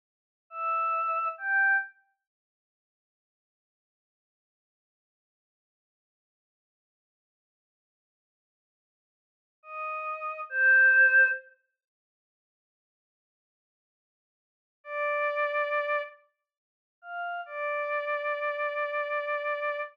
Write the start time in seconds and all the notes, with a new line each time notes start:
0.50 E5
1.38 G5
9.63 D#5
10.49 C5
14.84 D5
17.02 F5
17.46 D5